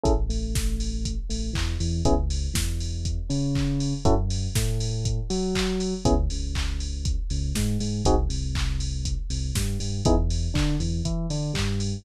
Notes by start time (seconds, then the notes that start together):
0.04 A1 C#4 E4 G#4 A4, kick, closed hi-hat
0.29 A1 A3, open hi-hat
0.55 kick, snare
0.80 open hi-hat
1.05 kick, closed hi-hat
1.30 A1 A3, open hi-hat
1.53 E2 E3, kick, clap
1.80 E2 E3, open hi-hat
2.05 C#2 B3 C#4 E4 G#4, kick, closed hi-hat
2.30 open hi-hat
2.54 E2 E3, kick, snare
2.80 open hi-hat
3.05 kick, closed hi-hat
3.30 C#3 C#4, open hi-hat
3.55 kick, clap
3.80 open hi-hat
4.05 F#2 C#4 E4 F#4 A4, kick, closed hi-hat
4.30 open hi-hat
4.55 A2 A3, kick, snare
4.80 open hi-hat
5.05 kick, closed hi-hat
5.30 F#3 F#4, open hi-hat
5.55 kick, clap
5.80 open hi-hat
6.05 C#2 B3 C#4 E4 G#4, kick, closed hi-hat
6.30 C#2 C#3, open hi-hat
6.55 kick, clap
6.80 open hi-hat
7.05 kick, closed hi-hat
7.30 C#2 C#3, open hi-hat
7.55 G#2 G#3, kick, snare
7.80 G#2 G#3, open hi-hat
8.05 C2 C4 D#4 F#4 G#4, kick, closed hi-hat
8.29 C2 C3, open hi-hat
8.55 kick, clap
8.80 open hi-hat
9.05 kick, closed hi-hat
9.30 C2 C3, open hi-hat
9.55 G2 G3, kick, snare
9.80 G2 G3, open hi-hat
10.05 E2 B3 D#4 E4 G#4, kick, closed hi-hat
10.30 open hi-hat
10.54 D3 D4, kick, clap
10.80 E2 E3, open hi-hat
11.05 E3 E4, kick, closed hi-hat
11.30 D3 D4, open hi-hat
11.54 G2 G3, kick, clap
11.80 open hi-hat